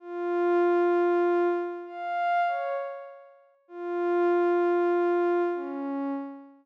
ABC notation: X:1
M:6/8
L:1/8
Q:3/8=65
K:Bbdor
V:1 name="Pad 5 (bowed)"
F5 z | f2 d z3 | F6 | D2 z4 |]